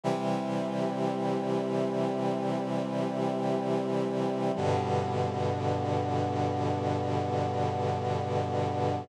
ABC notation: X:1
M:4/4
L:1/8
Q:1/4=53
K:G
V:1 name="Brass Section" clef=bass
[C,E,G,]8 | [G,,B,,D,]8 |]